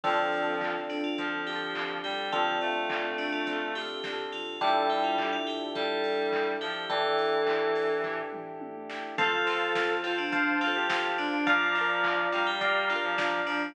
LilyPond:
<<
  \new Staff \with { instrumentName = "Tubular Bells" } { \time 4/4 \key d \minor \tempo 4 = 105 f'4. d'16 f'8. g'4 g'8 | f'4. d'16 f'8. g'4 f'8 | a'8 g'16 f'8 f'16 g'8 a'4. g'8 | a'2 r2 |
f'4. f'16 d'8. f'4 d'8 | f'4. f'16 g'8. f'4 d'8 | }
  \new Staff \with { instrumentName = "Clarinet" } { \time 4/4 \key d \minor f4. r8 f4. g8 | f8 a2~ a8 r4 | g4. r8 g4. f8 | e2~ e8 r4. |
a'4. c''4~ c''16 g'8. d'8 | f4. g4~ g16 f8. f8 | }
  \new Staff \with { instrumentName = "Electric Piano 1" } { \time 4/4 \key d \minor <c' d' f' a'>1 | <c' d' f' a'>1 | <d' e' g' a'>1 | <d' e' g' a'>1 |
<c'' f'' a''>2 <c'' f'' a''>2 | <d'' f'' bes''>2 <d'' f'' bes''>2 | }
  \new Staff \with { instrumentName = "Acoustic Guitar (steel)" } { \time 4/4 \key d \minor <c' d' f' a'>4 <c' d' f' a'>4 <c' d' f' a'>8 <c' d' f' a'>8 <c' d' f' a'>4~ | <c' d' f' a'>4 <c' d' f' a'>4 <c' d' f' a'>8 <c' d' f' a'>8 <c' d' f' a'>4 | <d' e' g' a'>4 <d' e' g' a'>4 <d' e' g' a'>4. <d' e' g' a'>8~ | <d' e' g' a'>4 <d' e' g' a'>4 <d' e' g' a'>4. <d' e' g' a'>8 |
<c' f' a'>8 <c' f' a'>8 <c' f' a'>8 <c' f' a'>4 <c' f' a'>8 <c' f' a'>4 | <d' f' bes'>8 <d' f' bes'>8 <d' f' bes'>8 <d' f' bes'>4 <d' f' bes'>8 <d' f' bes'>4 | }
  \new Staff \with { instrumentName = "Synth Bass 1" } { \clef bass \time 4/4 \key d \minor d,1 | d,2. b,,8 bes,,8 | a,,1 | a,,1 |
f,1 | bes,,1 | }
  \new Staff \with { instrumentName = "Pad 2 (warm)" } { \time 4/4 \key d \minor <c' d' f' a'>1~ | <c' d' f' a'>1 | <d' e' g' a'>1~ | <d' e' g' a'>1 |
<c'' f'' a''>1 | <d'' f'' bes''>1 | }
  \new DrumStaff \with { instrumentName = "Drums" } \drummode { \time 4/4 <cymc bd>8 hho8 <hc bd>8 <hho sn>8 <hh bd>8 hho8 <hc bd>8 hho8 | <hh bd>8 hho8 <hc bd>8 <hho sn>8 <hh bd>8 hho8 <bd sn>8 hho8 | <hh bd>8 hho8 <hc bd>8 <hho sn>8 <hh bd>8 hho8 <hc bd>8 hho8 | <hh bd>8 hho8 <hc bd>8 <hho sn>8 <bd tomfh>8 toml8 tommh8 sn8 |
<hh bd>8 hho8 <bd sn>8 hho8 <hh bd>8 hho8 <bd sn>8 hho8 | <hh bd>8 hho8 <hc bd>8 hho8 <hh bd>8 hho8 <bd sn>8 hho8 | }
>>